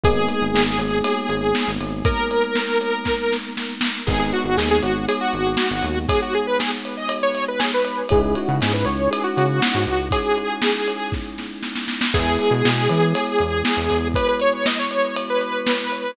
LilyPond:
<<
  \new Staff \with { instrumentName = "Lead 2 (sawtooth)" } { \time 4/4 \key gis \minor \tempo 4 = 119 gis'1 | ais'2. r4 | gis'16 gis'16 fis'16 fis'16 gis'16 gis'16 fis'8 gis'16 fis'4.~ fis'16 | gis'16 fis'16 gis'16 b'16 gis'16 r8 dis''8 cis''8 b'16 gis'16 b'8. |
gis'16 gis'16 fis'16 fis'16 gis'16 b'16 cis''8 gis'16 fis'4.~ fis'16 | gis'2~ gis'8 r4. | gis'1 | b'16 b'16 cis''16 cis''16 dis''16 cis''16 cis''8 r16 b'4.~ b'16 | }
  \new Staff \with { instrumentName = "Electric Piano 1" } { \time 4/4 \key gis \minor <gis ais b dis'>1~ | <gis ais b dis'>1 | <gis b dis'>1~ | <gis b dis'>1 |
<gis cis' dis' e'>1~ | <gis cis' dis' e'>1 | <gis b e'>1~ | <gis b e'>1 | }
  \new Staff \with { instrumentName = "Synth Bass 1" } { \clef bass \time 4/4 \key gis \minor gis,,8. gis,,16 gis,,8 gis,,4 gis,,8. gis,,16 gis,,8~ | gis,,1 | gis,,8. gis,,16 dis,8 gis,,4 gis,,8. gis,,16 dis,8~ | dis,1 |
cis,8. cis16 gis,8 cis,4 cis8. gis,16 cis,8~ | cis,1 | e,8. b,16 b,8 e4 e,8. e,16 e,8~ | e,1 | }
  \new DrumStaff \with { instrumentName = "Drums" } \drummode { \time 4/4 <bd cymr>8 cymr8 sn8 cymr8 cymr8 cymr8 sn8 cymr8 | <bd cymr>8 cymr8 sn8 cymr8 <bd sn>8 sn8 sn8 sn8 | <cymc bd>8 cymr8 sn8 cymr8 cymr8 cymr8 sn8 cymr8 | <bd cymr>8 cymr8 sn8 cymr8 cymr8 cymr8 sn8 cymr8 |
<bd cymr>8 cymr8 <cymr sn>8 cymr8 cymr8 cymr8 sn8 cymr8 | <bd cymr>8 cymr8 sn8 cymr8 <bd sn>8 sn8 sn16 sn16 sn16 sn16 | <cymc bd>8 cymr8 sn8 cymr8 cymr8 cymr8 sn8 cymr8 | <bd cymr>8 cymr8 <cymr sn>8 cymr8 cymr8 cymr8 sn8 cymr8 | }
>>